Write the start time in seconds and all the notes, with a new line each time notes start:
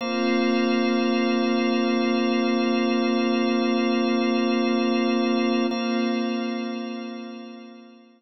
0.01 A#3 C4 F4 C5 F5
5.71 A#3 C4 F4 C5 F5